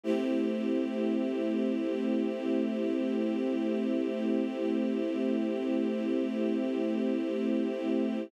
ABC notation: X:1
M:4/4
L:1/8
Q:1/4=58
K:Cmix
V:1 name="String Ensemble 1"
[A,CEG]8- | [A,CEG]8 |]